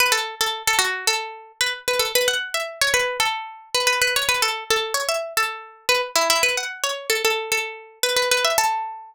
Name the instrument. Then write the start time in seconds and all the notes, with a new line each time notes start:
pizzicato strings
0.00 B4
0.12 A4
0.41 A4
0.67 A4
0.79 F#4
1.07 A4
1.61 B4
1.88 B4
1.99 A4
2.15 B4
2.28 F#5
2.54 E5
2.81 C#5
2.94 B4
3.20 A4
3.75 B4
3.87 B4
4.02 B4
4.16 C#5
4.29 B4
4.42 A4
4.70 A4
4.94 C#5
5.09 E5
5.37 A4
5.89 B4
6.16 E4
6.30 E4
6.43 B4
6.57 F#5
6.84 C#5
7.10 A4
7.25 A4
7.52 A4
8.03 B4
8.17 B4
8.31 B4
8.45 E5
8.58 A4